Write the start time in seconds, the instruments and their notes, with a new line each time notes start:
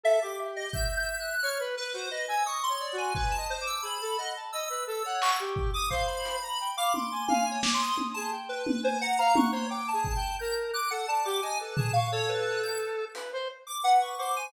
0.03 lead 1 (square) A4 E5
0.22 lead 1 (square) G4 D6
0.56 lead 1 (square) D#5
0.73 lead 1 (square) E5 G6, kick
0.96 lead 1 (square) G6
1.20 lead 1 (square) F#6
1.42 lead 1 (square) C#5 F6
1.60 lead 1 (square) B4
1.77 lead 1 (square) B4
1.94 lead 1 (square) F#4 C5
2.10 lead 1 (square) B4 D#5
2.28 lead 1 (square) G#5 E6
2.46 lead 1 (square) C#6 D#6
2.63 lead 1 (square) C6
2.69 lead 1 (square) C#5
2.81 lead 1 (square) D5
2.93 lead 1 (square) F#4
2.98 lead 1 (square) G#5
3.15 lead 1 (square) B4 G#5, kick
3.31 lead 1 (square) A5
3.37 lead 1 (square) D#5
3.50 lead 1 (square) C5
3.61 lead 1 (square) D6
3.67 lead 1 (square) E6
3.83 lead 1 (square) G#4 B5
4.01 lead 1 (square) A4
4.18 lead 1 (square) D#5 F#5
4.36 lead 1 (square) A5
4.52 lead 1 (square) D#5 E6
4.70 lead 1 (square) B4
4.87 lead 1 (square) A4 E6
5.04 lead 1 (square) C#5 F#5
5.22 lead 1 (square) C#6, clap
5.40 lead 1 (square) G4
5.56 kick
5.73 lead 1 (square) D6 D#6
5.90 lead 1 (square) C5 F5, kick
6.07 lead 1 (square) B5
6.25 closed hi-hat
6.42 lead 1 (square) A#5
6.60 lead 1 (square) G5
6.77 lead 1 (square) F5 D6
6.93 lead 1 (square) C6 D6, high tom
7.12 lead 1 (square) G#5
7.28 lead 1 (square) F5 G#5, high tom
7.45 lead 1 (square) G#5
7.51 lead 1 (square) C#5
7.63 lead 1 (square) D6, snare
7.74 lead 1 (square) C6
7.81 lead 1 (square) D#6
7.98 high tom
8.14 lead 1 (square) G#4 A5
8.31 lead 1 (square) G5
8.49 lead 1 (square) B4
8.67 high tom
8.83 lead 1 (square) C5 G#5
9.01 lead 1 (square) F#5 A#5
9.18 lead 1 (square) F5 A#5
9.35 lead 1 (square) C#6 F#6, high tom
9.51 lead 1 (square) C5 C#5
9.69 lead 1 (square) G5 D6
9.88 lead 1 (square) A5
9.93 lead 1 (square) G#4
10.04 kick
10.16 lead 1 (square) G5
10.39 lead 1 (square) A#4 G6
10.73 lead 1 (square) D6 F#6
10.91 lead 1 (square) A4 F#5
11.07 lead 1 (square) D5 A5
11.25 lead 1 (square) G4 D6
11.42 lead 1 (square) D#5 G#5
11.59 lead 1 (square) A4 B4
11.76 lead 1 (square) G#4 A5, floor tom
11.93 lead 1 (square) F5 C#6
12.12 lead 1 (square) A4 C#5
12.29 lead 1 (square) B4
12.63 lead 1 (square) G6
13.15 lead 1 (square) B4, closed hi-hat
13.33 lead 1 (square) C5
13.67 lead 1 (square) D6
13.83 lead 1 (square) B4 F#5
14.01 lead 1 (square) C#6
14.18 lead 1 (square) C5 D6
14.36 lead 1 (square) G#5